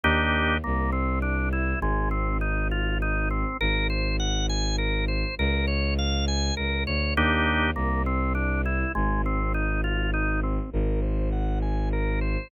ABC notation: X:1
M:3/4
L:1/8
Q:1/4=101
K:Ebmix
V:1 name="Drawbar Organ"
[B,=DEG]2 B, C D =E | A, C E F E C | B c _g a B c | B d f a B d |
[B,=DEG]2 B, C D =E | A, C E F E C | B c _g a B c |]
V:2 name="Violin" clef=bass
E,,2 C,,4 | A,,,6 | A,,,6 | D,,4 D,, =D,, |
E,,2 C,,4 | A,,,6 | A,,,6 |]